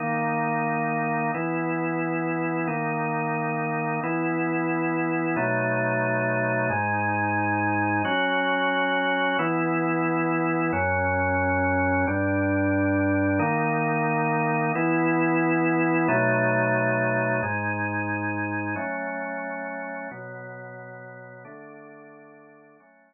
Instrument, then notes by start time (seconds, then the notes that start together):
drawbar organ
0.00 D#3 A#3 D#4
1.34 E3 B3 E4
2.67 D#3 A#3 D#4
4.03 E3 B3 E4
5.36 B2 F#3 A3 D#4
6.70 G#2 G#3 D#4
8.05 F#3 C#4 F#4
9.39 E3 B3 E4
10.73 F#2 F#3 C#4
12.07 G2 G3 D4
13.39 D#3 A#3 D#4
14.75 E3 B3 E4
16.08 B2 F#3 A3 D#4
17.43 G#2 G#3 D#4
18.76 F#3 A3 C#4
20.11 B2 F#3 B3
21.45 D3 A3 D4
22.80 F#3 A3 C#4